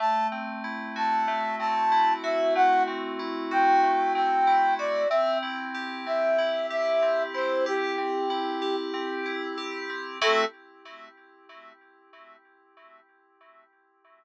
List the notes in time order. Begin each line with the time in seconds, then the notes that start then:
0.00 A3 A5
0.32 C4
0.64 E4
0.96 F#4 A5
1.28 A3
1.59 C4 A5
1.92 E4
2.23 F#4 E5
2.55 A3 F#5
2.87 C4
3.19 E4
3.51 F#4 G5
3.83 A3
4.14 C4 G5
4.47 E4
4.79 F#4 D5
5.09 C4 E5
5.43 E4
5.74 G4
6.06 C4 E5
6.38 E4
6.70 G4 E5
7.02 C4
7.34 E4 C5
7.66 G4
7.98 C4
8.30 E4
8.62 G4
8.94 C4
9.26 E4
9.57 G4
9.89 C4
10.21 A3 C4 E4 F#4 A4